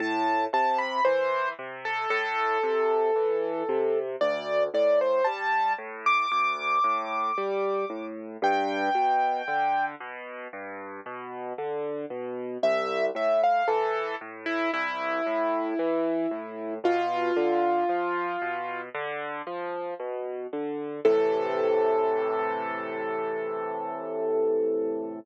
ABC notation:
X:1
M:4/4
L:1/16
Q:1/4=57
K:Am
V:1 name="Acoustic Grand Piano"
a2 a b c2 z A A8 | d2 d c a2 z d' d'8 | g6 z10 | e2 e f A2 z E E8 |
F8 z8 | A16 |]
V:2 name="Acoustic Grand Piano" clef=bass
A,,2 C,2 E,2 C,2 A,,2 C,2 E,2 C,2 | D,,2 A,,2 G,2 A,,2 D,,2 A,,2 G,2 A,,2 | G,,2 B,,2 D,2 B,,2 G,,2 B,,2 D,2 B,,2 | C,,2 A,,2 E,2 A,,2 C,,2 A,,2 E,2 A,,2 |
B,,2 D,2 F,2 B,,2 D,2 F,2 B,,2 D,2 | [A,,C,E,]16 |]